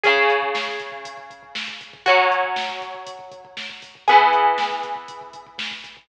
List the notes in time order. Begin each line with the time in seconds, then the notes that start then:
0.03 C#3 C#4 G#4, kick, closed hi-hat
0.16 kick
0.30 kick, closed hi-hat
0.42 kick
0.54 kick, snare
0.67 kick
0.80 kick, closed hi-hat
0.92 kick
1.05 kick, closed hi-hat
1.17 kick
1.30 kick, closed hi-hat
1.43 kick
1.55 kick, snare
1.68 kick
1.81 kick, closed hi-hat
1.93 kick
2.06 F#3 C#4 F#4, kick, closed hi-hat
2.18 kick
2.31 kick, closed hi-hat
2.43 kick
2.56 kick, snare
2.69 kick
2.81 kick, closed hi-hat
2.94 kick
3.07 kick, closed hi-hat
3.19 kick
3.32 kick, closed hi-hat
3.45 kick
3.57 kick, snare
3.69 kick
3.82 kick, open hi-hat
3.95 kick
4.08 E3 B3 G#4, kick, closed hi-hat
4.20 kick
4.33 kick, closed hi-hat
4.46 kick
4.58 kick, snare
4.70 kick
4.83 kick, closed hi-hat
4.96 kick
5.08 kick, closed hi-hat
5.21 kick
5.33 kick, closed hi-hat
5.47 kick
5.58 kick, snare
5.71 kick
5.84 kick, closed hi-hat
5.97 kick